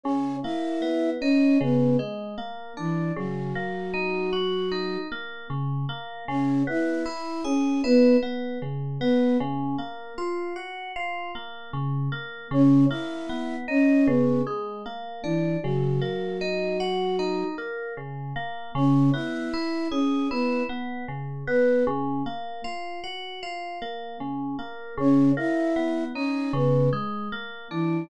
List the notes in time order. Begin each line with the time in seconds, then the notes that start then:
0.04 C#3 C#4 C#5
0.43 A#3 E4 E5
0.82 B3
1.20 C#4 D#4 C#5
1.61 C#3 B3 B4
1.99 G#3
2.38 A#3
2.77 E3 D4 E4
3.16 C#3 F#3 F#4
3.55 A#3
3.94 D#4
4.33 F#4
4.72 D#4
5.12 A#3
5.50 C#3
5.89 A#3
6.28 C#3 C#4 C#5
6.67 B3 E4 E5
7.06 E4
7.44 C#4 G#4 C#5
7.84 B3 E4 B4
8.23 B3
8.62 C#3
9.00 B3 B4
9.40 C#3
9.78 A#3
10.18 F4
10.56 F#4
10.96 F4
11.35 A#3
11.73 C#3
12.12 A#3
12.51 C#3 C#4 C#5
12.89 A#3 E4 E5
13.29 B3
13.68 C#4 D#4 C#5
14.06 C#3 B3 B4
14.47 G#3
14.86 A#3
15.23 E3 D4 E4
15.63 C#3 F#3 F#4
16.01 A#3
16.41 D#4
16.80 F#4
17.19 D#4
17.58 A#3
17.97 C#3
18.36 A#3
18.75 C#3 C#4 C#5
19.12 B3 E4 E5
19.54 E4
19.91 C#4 G#4 C#5
20.30 B3 E4 B4
20.69 B3
21.08 C#3
21.47 B3 B4
21.87 C#3
22.26 A#3
22.64 F4
23.04 F#4
23.43 F4
23.82 A#3
24.20 C#3
24.59 A#3
24.97 C#3 C#4 C#5
25.37 A#3 E4 E5
25.76 B3
26.14 C#4 D#4 C#5
26.53 C#3 B3 B4
26.93 G#3
27.32 A#3
27.70 E3 D4 E4